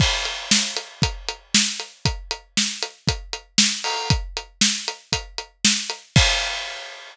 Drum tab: CC |x-------|--------|--------|x-------|
HH |-x-xxx-x|xx-xxx-o|xx-xxx-x|--------|
SD |--o---o-|--o---o-|--o---o-|--------|
BD |o---o---|o---o---|o---o---|o-------|